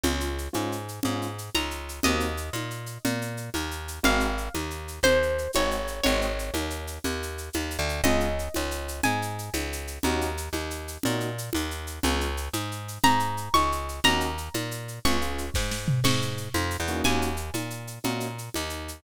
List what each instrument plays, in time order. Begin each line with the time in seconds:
0.03 electric bass (finger) C#2, acoustic grand piano G#3 C#4 F4, low conga, shaker
0.20 shaker
0.38 shaker
0.53 electric bass (finger) G#2, acoustic grand piano G#3 C#4 F4, high conga, shaker
0.72 shaker
0.88 shaker
1.03 electric bass (finger) G#2, acoustic grand piano G#3 C#4 F4, low conga, shaker
1.22 shaker
1.38 shaker
1.55 electric bass (finger) C#2, acoustic guitar (steel) A#5, high conga, shaker
1.71 shaker
1.89 shaker
2.03 electric bass (finger) D#2, acoustic grand piano A#3 C4 D#4 F#4, acoustic guitar (steel) D#5, low conga, shaker
2.20 shaker
2.37 shaker
2.53 electric bass (finger) A#2, high conga, shaker
2.70 shaker
2.86 shaker
3.05 electric bass (finger) A#2, low conga, shaker
3.22 shaker
3.37 shaker
3.54 electric bass (finger) D#2, high conga, shaker
3.71 shaker
3.88 shaker
4.03 electric bass (finger) G#1, acoustic grand piano G#3 C4 D#4 F#4, acoustic guitar (steel) F5, low conga, shaker
4.20 shaker
4.38 shaker
4.54 electric bass (finger) D#2, high conga, shaker
4.70 shaker
4.88 shaker
5.03 electric bass (finger) D#2, acoustic guitar (steel) C5, low conga, shaker
5.22 shaker
5.38 shaker
5.53 electric bass (finger) G#1, acoustic grand piano G#3 C4 D#4 F#4, acoustic guitar (steel) C#5, high conga, shaker
5.71 shaker
5.87 shaker
6.03 electric bass (finger) G#1, acoustic grand piano G#3 C4 D#4 F#4, acoustic guitar (steel) C#5, low conga, shaker
6.21 shaker
6.39 shaker
6.54 electric bass (finger) D#2, high conga, shaker
6.70 shaker
6.87 shaker
7.04 electric bass (finger) D#2, low conga, shaker
7.22 shaker
7.38 shaker
7.53 electric bass (finger) D#2, high conga, shaker
7.71 shaker
7.79 electric bass (finger) D2
7.89 shaker
8.04 electric bass (finger) C#2, acoustic grand piano G#3 C#4 F4, acoustic guitar (steel) D#5, low conga, shaker
8.20 shaker
8.39 shaker
8.54 electric bass (finger) C#2, high conga, shaker
8.71 shaker
8.88 shaker
9.03 electric bass (finger) G#2, acoustic guitar (steel) G#5, low conga, shaker
9.22 shaker
9.38 shaker
9.53 electric bass (finger) C#2, high conga, shaker
9.72 shaker
9.87 shaker
10.03 electric bass (finger) D#2, acoustic grand piano A#3 C#4 D#4 F#4, low conga, shaker
10.21 shaker
10.37 shaker
10.53 electric bass (finger) D#2, high conga, shaker
10.70 shaker
10.88 shaker
11.03 electric bass (finger) A#2, acoustic grand piano A#3 C#4 D#4 F#4, low conga, shaker
11.20 shaker
11.38 shaker
11.53 electric bass (finger) D#2, high conga, shaker
11.71 shaker
11.87 shaker
12.03 electric bass (finger) C#2, acoustic grand piano G#3 C#4 F4, low conga, shaker
12.21 shaker
12.37 shaker
12.53 electric bass (finger) G#2, high conga, shaker
12.72 shaker
12.88 shaker
13.04 electric bass (finger) G#2, acoustic guitar (steel) A#5, low conga, shaker
13.19 shaker
13.37 shaker
13.54 electric bass (finger) C#2, acoustic guitar (steel) C#6, high conga, shaker
13.72 shaker
13.89 shaker
14.04 electric bass (finger) D#2, acoustic grand piano A#3 C#4 D#4 F#4, acoustic guitar (steel) A#5, low conga, shaker
14.20 shaker
14.38 shaker
14.54 electric bass (finger) A#2, high conga, shaker
14.71 shaker
14.88 shaker
15.05 electric bass (finger) C#2, acoustic grand piano G#3 C#4 F4, acoustic guitar (steel) C#6, low conga, shaker
15.21 acoustic grand piano G#3 C#4 F4, shaker
15.38 shaker
15.54 electric bass (finger) G#2, kick, snare
15.71 snare
15.88 floor tom
16.04 electric bass (finger) G#2, acoustic guitar (steel) C#6, crash, low conga, shaker
16.22 shaker
16.37 shaker
16.54 electric bass (finger) F2, high conga, shaker
16.70 shaker
16.80 electric bass (finger) E2
16.87 acoustic grand piano A#3 C#4 D#4 F#4, shaker
17.04 electric bass (finger) D#2, acoustic guitar (steel) G#5, low conga, shaker
17.22 shaker
17.37 shaker
17.54 electric bass (finger) A#2, high conga, shaker
17.70 shaker
17.87 shaker
18.04 electric bass (finger) A#2, acoustic grand piano A#3 C#4 D#4 F#4, low conga, shaker
18.20 shaker
18.38 shaker
18.54 electric bass (finger) D#2, high conga, shaker
18.69 shaker
18.88 shaker